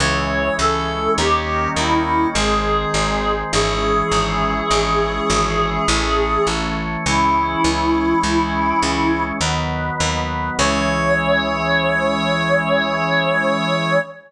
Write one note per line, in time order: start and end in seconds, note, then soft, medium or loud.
0.00 0.50 C#2 loud
0.00 1.17 E3 medium
0.00 1.17 G#3 medium
0.00 1.17 C#4 medium
0.00 0.54 C#5 medium
0.59 1.09 C#2 medium
0.59 1.12 A4 medium
1.18 1.68 D#2 medium
1.18 2.35 D#3 medium
1.18 2.35 G3 medium
1.18 2.35 A#3 medium
1.18 2.35 C#4 medium
1.18 1.68 G4 medium
1.76 2.26 D#2 medium
1.76 2.27 E4 medium
2.35 2.85 G#1 loud
2.35 3.52 D#3 medium
2.35 3.52 G#3 medium
2.35 3.52 C4 medium
2.35 3.32 G#4 medium
2.94 3.44 G#1 medium
3.53 4.03 G#1 loud
3.53 5.86 E3 medium
3.53 5.86 G#3 medium
3.53 5.86 C#4 medium
3.53 6.49 G#4 medium
4.12 4.62 G#1 medium
4.71 5.21 G#1 medium
5.30 5.80 G#1 medium
5.88 6.38 A1 loud
5.88 7.05 E3 medium
5.88 7.05 A3 medium
5.88 7.05 C#4 medium
6.47 6.97 A1 medium
7.06 7.56 C#2 loud
7.06 9.39 E3 medium
7.06 9.39 G#3 medium
7.06 9.39 C#4 medium
7.06 9.23 E4 medium
7.64 8.14 C#2 medium
8.23 8.73 C#2 medium
8.82 9.32 C#2 medium
9.41 9.91 D#2 medium
9.41 10.57 D#3 medium
9.41 10.57 F#3 medium
9.41 10.57 B3 medium
10.00 10.50 D#2 medium
10.59 13.99 C#2 loud
10.59 13.99 E3 loud
10.59 13.99 G#3 loud
10.59 13.99 C#4 loud
10.59 13.99 C#5 loud